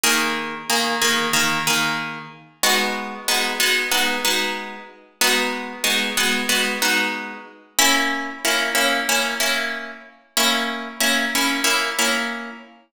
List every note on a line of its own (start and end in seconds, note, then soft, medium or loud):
0.03 0.55 D#3 medium
0.03 0.55 A#3 medium
0.03 0.55 G#4 medium
0.70 0.95 D#3 medium
0.70 0.95 A#3 medium
0.70 0.95 G#4 medium
1.01 1.27 D#3 medium
1.01 1.27 A#3 medium
1.01 1.27 G#4 medium
1.33 1.59 D#3 medium
1.33 1.59 A#3 medium
1.33 1.59 G#4 medium
1.67 2.19 D#3 medium
1.67 2.19 A#3 medium
1.67 2.19 G#4 medium
2.63 3.15 G#3 medium
2.63 3.15 B3 medium
2.63 3.15 D#4 medium
2.63 3.15 F#4 medium
3.28 3.54 G#3 medium
3.28 3.54 B3 medium
3.28 3.54 D#4 medium
3.28 3.54 F#4 medium
3.60 3.86 G#3 medium
3.60 3.86 B3 medium
3.60 3.86 D#4 medium
3.60 3.86 F#4 medium
3.91 4.17 G#3 medium
3.91 4.17 B3 medium
3.91 4.17 D#4 medium
3.91 4.17 F#4 medium
4.25 4.76 G#3 medium
4.25 4.76 B3 medium
4.25 4.76 D#4 medium
4.25 4.76 F#4 medium
5.21 5.73 G#3 medium
5.21 5.73 B3 medium
5.21 5.73 D#4 medium
5.21 5.73 F#4 medium
5.84 6.10 G#3 medium
5.84 6.10 B3 medium
5.84 6.10 D#4 medium
5.84 6.10 F#4 medium
6.17 6.43 G#3 medium
6.17 6.43 B3 medium
6.17 6.43 D#4 medium
6.17 6.43 F#4 medium
6.49 6.75 G#3 medium
6.49 6.75 B3 medium
6.49 6.75 D#4 medium
6.49 6.75 F#4 medium
6.82 7.34 G#3 medium
6.82 7.34 B3 medium
6.82 7.34 D#4 medium
6.82 7.34 F#4 medium
7.78 8.30 A#3 medium
7.78 8.30 C#4 medium
7.78 8.30 E4 medium
8.45 8.70 A#3 medium
8.45 8.70 C#4 medium
8.45 8.70 E4 medium
8.75 9.01 A#3 medium
8.75 9.01 C#4 medium
8.75 9.01 E4 medium
9.09 9.35 A#3 medium
9.09 9.35 C#4 medium
9.09 9.35 E4 medium
9.40 9.92 A#3 medium
9.40 9.92 C#4 medium
9.40 9.92 E4 medium
10.37 10.88 A#3 medium
10.37 10.88 C#4 medium
10.37 10.88 E4 medium
11.00 11.26 A#3 medium
11.00 11.26 C#4 medium
11.00 11.26 E4 medium
11.35 11.61 A#3 medium
11.35 11.61 C#4 medium
11.35 11.61 E4 medium
11.64 11.90 A#3 medium
11.64 11.90 C#4 medium
11.64 11.90 E4 medium
11.99 12.50 A#3 medium
11.99 12.50 C#4 medium
11.99 12.50 E4 medium